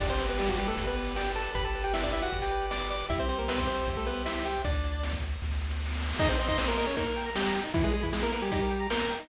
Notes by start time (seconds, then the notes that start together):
0.00 G1 D4 G4 D5, kick, crash
0.10 C4 C5, closed hi-hat
0.19 B4, closed hi-hat
0.29 B3 B4, closed hi-hat
0.39 G3 G4 D5, snare
0.48 F#3 F#4, kick, closed hi-hat
0.58 G3 G4 B4, closed hi-hat
0.68 A3 A4, closed hi-hat
0.76 G1 G4, kick, closed hi-hat
0.87 B3 B4, closed hi-hat
0.96 B4, closed hi-hat
1.06 closed hi-hat
1.16 G4 D5 G5, snare
1.26 closed hi-hat
1.35 A4 B4 A5, closed hi-hat
1.45 closed hi-hat
1.54 G1 G4 B4 B5, kick, closed hi-hat
1.65 A4 A5, closed hi-hat
1.74 B4, closed hi-hat
1.84 G4 G5, closed hi-hat
1.94 E4 D5 E5, snare
2.03 D4 D5, kick, closed hi-hat
2.13 E4 B4 E5, closed hi-hat
2.23 F#4 F#5, closed hi-hat
2.31 G1 G4, kick
2.42 G4 G5, closed hi-hat
2.51 B4, closed hi-hat
2.61 closed hi-hat
2.71 D5 D6, snare
2.81 closed hi-hat
2.89 B4 D5 D6, closed hi-hat
3.00 closed hi-hat
3.09 C2 E4 G4 E5, kick, closed hi-hat
3.19 C4 C5, closed hi-hat
3.29 C4 C5, closed hi-hat
3.39 A#3 A#4, closed hi-hat
3.48 B3 B4 E5, snare
3.58 C4 C5, kick, closed hi-hat
3.68 C5, closed hi-hat
3.77 closed hi-hat
3.87 C2 G4, kick, closed hi-hat
3.97 A3 A4, closed hi-hat
4.06 B3 B4 C5, closed hi-hat
4.16 closed hi-hat
4.25 E4 E5, snare
4.35 closed hi-hat
4.45 G4 C5 G5, closed hi-hat
4.65 D2 D4 D5, kick, closed hi-hat
4.74 closed hi-hat
4.84 closed hi-hat
4.94 closed hi-hat
5.03 snare
5.13 kick, closed hi-hat
5.23 closed hi-hat
5.32 closed hi-hat
5.42 D2, kick, snare
5.52 snare
5.61 snare
5.71 snare
5.81 snare
5.85 snare
5.90 snare
5.95 snare
6.00 snare
6.05 snare
6.10 snare
6.15 snare
6.19 D#4 G#4 D#5, kick, crash
6.29 C4 C5
6.39 C4 C5 D#5, closed hi-hat
6.48 D#4 D#5 C6, kick
6.58 C4 C5 D#6, snare
6.68 A#3 A#4 C6
6.77 A#3 A#4 D#5, closed hi-hat
6.86 C#4 G#4 C#5
6.97 A#3 D#4 A#4, kick, closed hi-hat
7.07 A#4
7.16 G5, closed hi-hat
7.26 A#5
7.35 G3 G4 G6, snare
7.45 A#5
7.55 G5, closed hi-hat
7.64 D#4
7.74 E3 E4, kick, closed hi-hat
7.84 G#3 G#4 B4
7.94 G#3 G#4 G#5, closed hi-hat
8.03 E3 E4 B5, kick
8.13 G#3 G#4 G#5, snare
8.23 A#3 E4 A#4
8.32 A#3 A#4 B4, closed hi-hat
8.42 G3 G4 G#5
8.52 G3 D#4 G4, kick, closed hi-hat
8.62 A#4
8.70 G5, closed hi-hat
8.80 A#5
8.90 A#3 A#4 G6, snare
9.00 A#5
9.10 G5, closed hi-hat
9.19 D#4